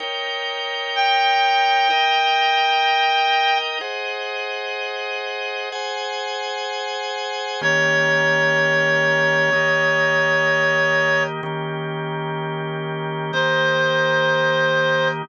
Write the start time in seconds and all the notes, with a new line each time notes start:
0.00 D#4 A#4 C#5 G5
0.96 G5
1.90 D#4 A#4 D#5 G5
3.81 G#4 C5 D#5 F#5
5.72 G#4 C5 F#5 G#5
7.61 D#3 A#3 C#4 G4 C#5
9.53 D#3 A#3 D#4 G4
11.43 D#3 A#3 C#4 G4
13.33 D#3 A#3 D#4 G4 C5